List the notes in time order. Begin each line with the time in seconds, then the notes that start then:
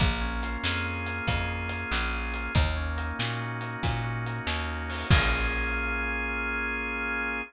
0.00 A#1 A#3, kick, closed hi-hat
0.21 C#4
0.43 F4, closed hi-hat
0.63 F2 G#4, snare
0.85 A#3
1.06 C#4, closed hi-hat
1.27 F2 F4, kick, closed hi-hat
1.50 G#4
1.69 A#3, closed hi-hat
1.91 A#1 C#4, snare
2.13 F4
2.34 G#4, closed hi-hat
2.55 D#2 A#3, kick, closed hi-hat
2.76 C#4
2.97 D#4, closed hi-hat
3.19 A#2 F#4, snare
3.41 A#3
3.61 C#4, closed hi-hat
3.83 A#2 D#4, kick, closed hi-hat
4.03 F#4
4.26 A#3, closed hi-hat
4.47 D#2 C#4, snare
4.68 D#4
4.89 F#4, open hi-hat
5.10 A#1 A#3 C#4 F4 G#4, kick, crash